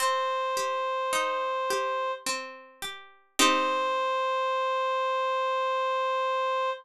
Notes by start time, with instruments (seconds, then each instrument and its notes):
0.00 harpsichord C4, clarinet C5
0.57 harpsichord G4
1.13 harpsichord D#4
1.70 harpsichord G4
2.26 harpsichord C4
2.82 harpsichord G4
3.39 harpsichord C4 D#4 G4, clarinet C5